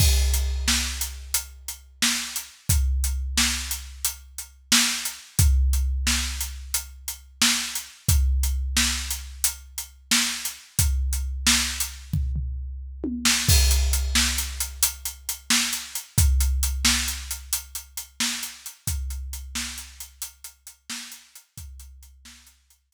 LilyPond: \new DrumStaff \drummode { \time 12/8 \tempo 4. = 89 <cymc bd>8. hh8. sn8. hh8. hh8. hh8. sn8. hh8. | <hh bd>8. hh8. sn8. hh8. hh8. hh8. sn8. hh8. | <hh bd>8. hh8. sn8. hh8. hh8. hh8. sn8. hh8. | <hh bd>8. hh8. sn8. hh8. hh8. hh8. sn8. hh8. |
<hh bd>8. hh8. sn8. hh8. <bd tomfh>8 tomfh4 r8 tommh8 sn8 | <cymc bd>8 hh8 hh8 sn8 hh8 hh8 hh8 hh8 hh8 sn8 hh8 hh8 | <hh bd>8 hh8 hh8 sn8 hh8 hh8 hh8 hh8 hh8 sn8 hh8 hh8 | <hh bd>8 hh8 hh8 sn8 hh8 hh8 hh8 hh8 hh8 sn8 hh8 hh8 |
<hh bd>8 hh8 hh8 sn8 hh8 hh8 hh4. r4. | }